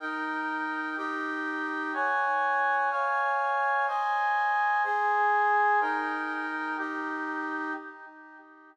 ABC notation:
X:1
M:6/8
L:1/8
Q:3/8=62
K:Eb
V:1 name="Brass Section"
[EBg]3 [EGg]3 | [_d_ga]3 [dfa]3 | [cea]3 [Aca]3 | [EBg]3 [EGg]3 |]